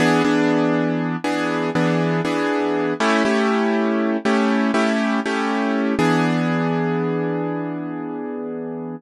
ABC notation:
X:1
M:12/8
L:1/8
Q:3/8=80
K:E
V:1 name="Acoustic Grand Piano"
[E,B,=DG] [E,B,DG]4 [E,B,DG]2 [E,B,DG]2 [E,B,DG]3 | [A,CE=G] [A,CEG]4 [A,CEG]2 [A,CEG]2 [A,CEG]3 | [E,B,=DG]12 |]